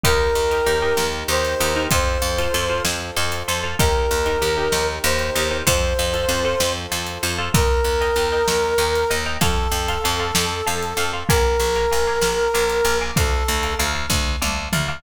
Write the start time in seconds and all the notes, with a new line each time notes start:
0.04 D#2 D#4 G4 A#4, kick, closed hi-hat
0.35 D#2
0.51 D#4 G4 A#4, closed hi-hat
0.66 D#2 D#4 G4 A#4
0.82 D#4 G4 A#4
0.97 D#2, snare
1.28 D#2 D#4 G4 A#4 C5
1.45 closed hi-hat
1.60 D#2 D#4 G4 A#4
1.76 D#4 G4 A#4
1.91 F2 F4 A4 C5, kick, closed hi-hat
2.22 F2
2.38 F4 A4 C5, closed hi-hat
2.54 F2 F4 A4 C5
2.70 F4 A4 C5
2.85 F2, snare
3.17 F2 F4 A4 C5
3.32 closed hi-hat
3.48 F2 F4 A4 C5
3.63 F4 A4 C5
3.79 D#2 D#4 G4 A#4, kick, closed hi-hat
4.11 D#2
4.26 D#4 G4 A#4, closed hi-hat
4.42 D#2 D#4 G4 A#4
4.57 D#4 G4 A#4
4.72 D#2, snare
5.04 D#2 D#4 G4 A#4 C5
5.19 closed hi-hat
5.35 D#2 D#4 G4 A#4
5.51 D#4 G4 A#4
5.67 F2 F4 A4 C5, kick, closed hi-hat
5.99 F2
6.13 F4 A4 C5, closed hi-hat
6.29 F2 F4 A4 C5
6.45 F4 A4 C5
6.60 F2, snare
6.92 F2 F4 A4 C5
7.07 closed hi-hat
7.23 F2 F4 A4 C5
7.38 F4 A4 C5
7.54 D#2 A#4 D#5 G5 A#5, kick, closed hi-hat
7.84 D#2
8.01 D#5 G5 A#5, closed hi-hat
8.16 D#2 D#5 G5 A#5
8.32 D#5 G5 A#5
8.48 D#2, snare
8.78 D#2 D#5 G5 A#5
8.95 closed hi-hat
9.10 D#2 D#5 G5 A#5
9.26 D#5 G5 A#5
9.41 F2 A4 F5 A5 C6, kick, closed hi-hat
9.71 F2
9.88 F5 A5 C6, closed hi-hat
10.04 F2 F5 A5 C6
10.20 F5 A5 C6
10.35 F2, snare
10.67 F2 F5 A5 C6
10.83 closed hi-hat
10.97 F2 F5 A5 C6
11.13 F5 A5 C6
11.29 A#1 A#4 F5 G#5 A#5 D6, kick, closed hi-hat
11.60 A#1
11.75 F5 G#5 A#5 D6, closed hi-hat
11.92 A#1 F5 G#5 A#5 D6
12.07 F5 G#5 A#5 D6
12.21 A#1, snare
12.54 A#1 F5 G#5 A#5 D6
12.70 closed hi-hat
12.85 A#1 F5 G#5 A#5 D6
13.01 F5 G#5 A#5 D6
13.16 D2 A4 F5 A5 D6, kick, closed hi-hat
13.48 D2
13.63 F5 A5 D6, closed hi-hat
13.79 D2 F5 A5 D6
13.95 F5 A5 D6
14.10 D2, kick, snare
14.42 D2 F5 A5 D6, high tom
14.73 D2 F5 A5 D6, mid tom
14.88 F5 A5 D6